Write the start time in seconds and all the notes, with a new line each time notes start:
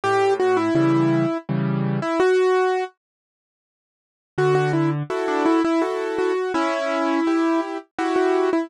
0.04 A2 G4
0.40 F#4
0.57 E4
0.75 C#3 E3 G3 E4
1.49 C#3 E3 G3
2.02 E4
2.20 F#4
4.38 D3 F#4
4.55 F#4
4.73 E4
5.10 E4 F#4 A4
5.28 D4
5.45 E4
5.64 E4
5.82 E4 F#4 A4
6.18 F#4
6.54 C#4 E4
7.27 E4 G4
7.98 E4 F#4 G4
8.16 F#4
8.53 E4